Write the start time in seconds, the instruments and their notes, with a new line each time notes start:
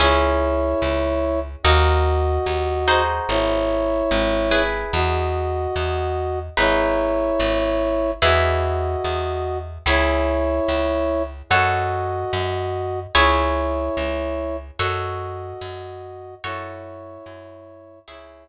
0.00 electric bass (finger) C#2, orchestral harp C#4 E4 G#4, brass section E4 C#5
0.82 electric bass (finger) C#2
1.63 electric bass (finger) D#2, orchestral harp D#4 F#4 A#4, brass section F#4 D#5
2.46 electric bass (finger) D#2
2.88 orchestral harp D#4 F#4 G#4 C5
3.29 electric bass (finger) G#1, brass section E4 C#5
4.11 electric bass (finger) G#1
4.51 orchestral harp E4 G#4 B4
4.93 electric bass (finger) E2, brass section F#4 D#5
5.76 electric bass (finger) E2
6.57 electric bass (finger) G#1, orchestral harp D#4 G#4 B4, brass section E4 C#5
7.40 electric bass (finger) G#1
8.22 electric bass (finger) E2, orchestral harp E4 G#4 B4, brass section F#4 D#5
9.04 electric bass (finger) E2
9.86 electric bass (finger) C#2, brass section E4 C#5, orchestral harp E4 G#4 C#5
10.68 electric bass (finger) C#2
11.50 electric bass (finger) F#2, brass section F#4 D#5, orchestral harp F#4 A4 C#5
12.33 electric bass (finger) F#2
13.15 electric bass (finger) C#2, orchestral harp E4 G#4 C#5, brass section E4 C#5
13.97 electric bass (finger) C#2
14.79 electric bass (finger) F#2, brass section F#4 D#5, orchestral harp F#4 A4 C#5
15.61 electric bass (finger) F#2
16.44 electric bass (finger) F#2, brass section E4 C#5, orchestral harp F#4 A4 C#5
17.26 electric bass (finger) F#2
18.08 electric bass (finger) C#2, orchestral harp E4 G#4 C#5, brass section E4 C#5